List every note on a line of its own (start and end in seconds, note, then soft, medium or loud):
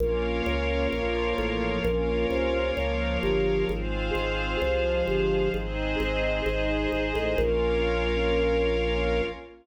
0.00 0.42 A#1 medium
0.00 0.91 A#3 loud
0.00 0.91 C#4 medium
0.00 0.91 F4 medium
0.00 1.83 A#4 loud
0.00 1.83 C#5 medium
0.00 1.83 F5 medium
0.46 0.88 C#2 medium
0.92 1.34 A#1 medium
0.92 1.85 F3 medium
0.92 1.84 A#3 medium
0.92 1.84 F4 medium
1.38 1.80 A1 medium
1.85 2.26 A#1 loud
1.85 2.76 A#3 medium
1.85 2.76 C#4 medium
1.85 2.76 F4 loud
1.85 3.68 A#4 loud
1.85 3.68 C#5 medium
1.85 3.68 F5 medium
2.30 2.72 C2 medium
2.76 3.19 C#2 medium
2.76 3.68 F3 medium
2.76 3.68 A#3 medium
2.76 3.68 F4 medium
3.23 3.65 G1 medium
3.69 4.11 G#1 medium
3.69 4.61 G#3 medium
3.69 4.61 C4 medium
3.69 4.61 F4 medium
3.69 5.52 G#4 medium
3.69 5.52 C5 medium
3.69 5.52 F5 medium
4.15 4.57 G#1 medium
4.62 5.03 C2 medium
4.62 5.53 F3 medium
4.62 5.53 G#3 medium
4.62 5.53 F4 medium
5.07 5.49 G1 medium
5.54 5.96 G#1 medium
5.54 6.45 G#3 medium
5.54 6.45 C4 medium
5.54 6.45 D#4 medium
5.54 7.37 G#4 medium
5.54 7.37 C5 medium
5.54 7.37 D#5 medium
6.00 6.42 G#1 medium
6.46 6.88 G#1 medium
6.46 7.37 G#3 medium
6.46 7.37 D#4 medium
6.46 7.37 G#4 medium
6.92 7.13 G#1 medium
7.15 7.36 A1 medium
7.38 9.22 A#1 loud
7.38 9.23 A#3 medium
7.38 9.23 C#4 medium
7.38 9.23 F4 loud
7.38 9.22 A#4 loud
7.38 9.22 C#5 loud
7.38 9.22 F5 loud